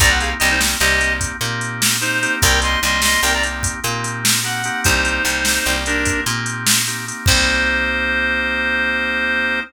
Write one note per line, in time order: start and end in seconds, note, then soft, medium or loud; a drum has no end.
0.00 0.34 C2 loud
0.00 0.37 A#3 medium
0.00 0.37 C4 medium
0.00 0.37 D#4 loud
0.00 0.37 G4 medium
0.00 0.10 D5 medium
0.00 0.10 A#5 loud
0.00 kick medium
0.00 closed hi-hat medium
0.09 0.19 F#5 medium
0.20 0.30 G#4 medium
0.20 0.30 F5 medium
0.20 closed hi-hat medium
0.39 0.76 C2 loud
0.39 0.58 A#3 medium
0.39 0.58 C4 medium
0.39 0.58 D#4 medium
0.39 0.49 G4 medium
0.39 0.58 G4 medium
0.39 0.49 D#5 medium
0.39 closed hi-hat medium
0.51 0.60 D#4 medium
0.51 0.60 C5 medium
0.59 0.78 A#3 medium
0.59 0.78 C4 medium
0.59 0.78 D#4 medium
0.59 0.78 G4 medium
0.59 snare medium
0.80 1.32 C2 medium
0.80 0.99 A#3 medium
0.80 0.99 C4 medium
0.80 0.99 D#4 medium
0.80 1.13 G4 medium
0.80 0.99 G4 medium
0.80 1.13 D#5 medium
0.80 closed hi-hat medium
1.00 1.37 A#3 medium
1.00 1.37 C4 medium
1.00 1.37 D#4 medium
1.00 1.37 G4 medium
1.00 closed hi-hat medium
1.21 kick medium
1.21 closed hi-hat medium
1.41 2.27 A#2 medium
1.41 1.97 A#3 medium
1.41 1.97 C4 medium
1.41 1.97 D#4 medium
1.41 1.97 G4 medium
1.41 closed hi-hat medium
1.61 closed hi-hat medium
1.82 snare loud
2.01 2.20 A#3 medium
2.01 2.20 C4 medium
2.01 2.20 D#4 medium
2.01 2.35 D#4 medium
2.01 2.20 G4 medium
2.01 2.35 C5 medium
2.01 closed hi-hat medium
2.23 2.80 A#3 medium
2.23 2.80 C4 medium
2.23 2.80 D#4 medium
2.23 2.80 G4 medium
2.23 closed hi-hat medium
2.42 2.77 C2 loud
2.42 2.60 A#4 medium
2.42 2.60 G5 medium
2.42 kick medium
2.42 closed hi-hat medium
2.62 2.80 D#5 medium
2.62 2.80 C6 medium
2.62 closed hi-hat medium
2.82 3.17 C2 medium
2.82 3.01 A#3 medium
2.82 3.01 C4 medium
2.82 3.01 D#4 medium
2.82 3.01 G4 medium
2.82 3.01 D#5 medium
2.82 3.01 C6 medium
2.82 closed hi-hat medium
3.02 3.21 A#3 medium
3.02 3.21 C4 medium
3.02 3.21 D#4 medium
3.02 3.21 G4 medium
3.02 3.21 D#5 medium
3.02 3.21 C6 medium
3.02 snare medium
3.23 3.74 C2 medium
3.23 3.43 A#3 medium
3.23 3.43 C4 medium
3.23 3.43 D#4 medium
3.23 3.43 G4 medium
3.23 3.33 A#4 medium
3.23 3.33 G5 medium
3.23 closed hi-hat medium
3.34 3.43 D5 medium
3.34 3.43 A#5 medium
3.43 3.80 A#3 medium
3.43 3.80 C4 medium
3.43 3.80 D#4 medium
3.43 3.80 G4 medium
3.43 closed hi-hat medium
3.63 kick medium
3.63 closed hi-hat medium
3.84 4.70 A#2 medium
3.84 4.40 A#3 medium
3.84 4.40 C4 medium
3.84 4.40 D#4 medium
3.84 4.40 G4 medium
3.84 closed hi-hat medium
4.04 closed hi-hat medium
4.25 snare loud
4.44 4.62 A#3 medium
4.44 4.62 C4 medium
4.44 4.62 D#4 medium
4.44 4.62 G4 medium
4.44 4.81 F#5 medium
4.44 closed hi-hat medium
4.64 5.23 A#3 medium
4.64 5.23 C4 medium
4.64 5.23 D#4 medium
4.64 5.23 G4 medium
4.64 closed hi-hat medium
4.84 5.20 C2 loud
4.84 5.76 D#4 medium
4.84 5.76 C5 medium
4.84 kick medium
4.84 closed hi-hat medium
5.05 closed hi-hat medium
5.25 5.59 C2 medium
5.25 5.43 A#3 medium
5.25 5.43 C4 medium
5.25 5.43 D#4 medium
5.25 5.43 G4 medium
5.25 closed hi-hat medium
5.45 5.65 A#3 medium
5.45 5.65 C4 medium
5.45 5.65 D#4 medium
5.45 5.65 G4 medium
5.45 snare medium
5.65 6.18 C2 medium
5.65 5.84 A#3 medium
5.65 5.84 C4 medium
5.65 5.84 D#4 medium
5.65 5.84 G4 medium
5.65 closed hi-hat medium
5.86 6.24 A#3 medium
5.86 6.24 C4 medium
5.86 6.21 D4 medium
5.86 6.24 D#4 medium
5.86 6.24 G4 medium
5.86 6.21 A#4 medium
5.86 closed hi-hat medium
6.05 kick medium
6.05 closed hi-hat medium
6.26 7.12 A#2 medium
6.26 6.82 A#3 medium
6.26 6.82 C4 medium
6.26 6.82 D#4 medium
6.26 6.82 G4 medium
6.26 closed hi-hat medium
6.46 closed hi-hat medium
6.67 snare loud
6.87 7.06 A#3 medium
6.87 7.06 C4 medium
6.87 7.06 D#4 medium
6.87 7.06 G4 medium
6.87 closed hi-hat medium
7.08 7.26 A#3 medium
7.08 7.26 C4 medium
7.08 7.26 D#4 medium
7.08 7.26 G4 medium
7.08 closed hi-hat medium
7.26 9.61 C2 loud
7.26 9.60 A#3 loud
7.26 9.60 C4 loud
7.26 9.60 D#4 loud
7.26 9.60 G4 loud
7.26 9.60 C5 loud
7.26 kick loud
7.26 crash loud